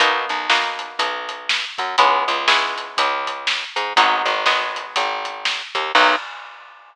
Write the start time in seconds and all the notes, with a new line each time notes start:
0.00 B1 A#3 B3 D#4 F#4, kick, closed hi-hat
0.29 B1, closed hi-hat
0.50 A#3 B3 D#4 F#4, snare
0.79 closed hi-hat
0.99 B1, kick, closed hi-hat
1.29 closed hi-hat
1.49 snare
1.78 F#2, kick, closed hi-hat
1.98 C#2 G#3 B3 C#4 E4, kick, closed hi-hat
2.28 C#2, closed hi-hat
2.48 G#3 B3 C#4 E4, snare
2.78 closed hi-hat
2.97 C#2, kick, closed hi-hat
3.27 kick, closed hi-hat
3.47 snare
3.76 G#2, closed hi-hat
3.96 G#1 F#3 G#3 B3 D#4, kick, closed hi-hat
4.25 G#1, closed hi-hat
4.46 F#3 G#3 B3 D#4, snare
4.76 closed hi-hat
4.96 G#1, kick, closed hi-hat
5.25 closed hi-hat
5.45 snare
5.75 D#2, kick, closed hi-hat
5.95 B1 A#3 B3 D#4 F#4, kick, crash